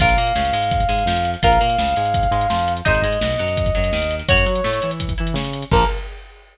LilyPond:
<<
  \new Staff \with { instrumentName = "Lead 2 (sawtooth)" } { \time 4/4 \key bes \minor \tempo 4 = 168 f''1 | f''1 | ees''1 | des''2 r2 |
bes'4 r2. | }
  \new Staff \with { instrumentName = "Overdriven Guitar" } { \time 4/4 \key bes \minor <f' bes'>8 bes8 des8 aes4 aes8 f4 | <f' bes'>8 bes8 des8 aes4 aes8 f4 | <ees' aes' c''>8 aes8 b,8 ges4 ges8 ees4 | <ges' des''>8 ges'8 a8 e'4 e'8 des'4 |
<f bes>4 r2. | }
  \new Staff \with { instrumentName = "Synth Bass 1" } { \clef bass \time 4/4 \key bes \minor bes,,8 bes,8 des,8 aes,4 aes,8 f,4 | bes,,8 bes,8 des,8 aes,4 aes,8 f,4 | aes,,8 aes,8 b,,8 ges,4 ges,8 ees,4 | ges,8 ges8 a,8 e4 e8 des4 |
bes,,4 r2. | }
  \new DrumStaff \with { instrumentName = "Drums" } \drummode { \time 4/4 <hh bd>16 hh16 hh16 hh16 sn16 hh16 hh16 hh16 <hh bd>16 <hh bd>16 hh16 hh16 sn16 hh16 hh16 hh16 | <hh bd>16 hh16 hh16 hh16 sn16 hh16 hh16 hh16 <hh bd>16 <hh bd>16 hh16 hh16 sn16 hh16 hh16 hh16 | <hh bd>16 hh16 hh16 hh16 sn16 hh16 hh16 hh16 <hh bd>16 <hh bd>16 hh16 hh16 sn16 hh16 hh16 hh16 | <hh bd>16 hh16 hh16 hh16 sn16 hh16 hh16 hh16 <hh bd>16 <hh bd>16 hh16 hh16 sn16 hh16 hh16 hh16 |
<cymc bd>4 r4 r4 r4 | }
>>